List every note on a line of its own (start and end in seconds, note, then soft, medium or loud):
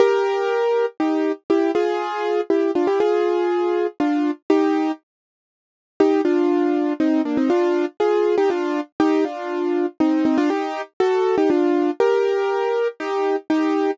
0.00 0.86 G4 medium
0.00 0.86 A#4 medium
1.00 1.32 D#4 medium
1.00 1.32 G4 medium
1.50 1.71 E4 medium
1.50 1.71 G4 medium
1.75 2.41 F4 medium
1.75 2.41 G#4 medium
2.50 2.71 E4 medium
2.50 2.71 G4 medium
2.75 2.87 D4 medium
2.75 2.87 F4 medium
2.87 2.99 E4 medium
2.87 2.99 G4 medium
3.00 3.87 F4 medium
3.00 3.87 G#4 medium
4.00 4.31 D4 medium
4.00 4.31 F4 medium
4.50 4.92 D#4 medium
4.50 4.92 G4 medium
6.00 6.21 D#4 medium
6.00 6.21 G4 medium
6.25 6.93 D4 medium
6.25 6.93 F4 medium
7.00 7.22 C4 medium
7.00 7.22 D#4 medium
7.25 7.37 A#3 medium
7.25 7.37 D4 medium
7.37 7.49 C4 medium
7.37 7.49 D#4 medium
7.50 7.85 D4 medium
7.50 7.85 F4 medium
8.00 8.36 F4 medium
8.00 8.36 G#4 medium
8.38 8.49 D#4 medium
8.38 8.49 G4 medium
8.50 8.81 D4 medium
8.50 8.81 F4 medium
9.00 9.24 D#4 medium
9.00 9.24 G4 medium
9.25 9.86 D4 medium
9.25 9.86 F4 medium
10.00 10.24 C4 medium
10.00 10.24 D#4 medium
10.25 10.37 C4 medium
10.25 10.37 D#4 medium
10.38 10.49 D4 medium
10.38 10.49 F4 medium
10.50 10.82 D#4 medium
10.50 10.82 G4 medium
11.00 11.36 F#4 medium
11.00 11.36 A4 medium
11.38 11.49 D#4 medium
11.38 11.49 G4 medium
11.50 11.91 D4 medium
11.50 11.91 F4 medium
12.00 12.88 G4 medium
12.00 12.88 A#4 medium
13.00 13.36 D#4 medium
13.00 13.36 G4 medium
13.50 13.91 D#4 medium
13.50 13.91 G4 medium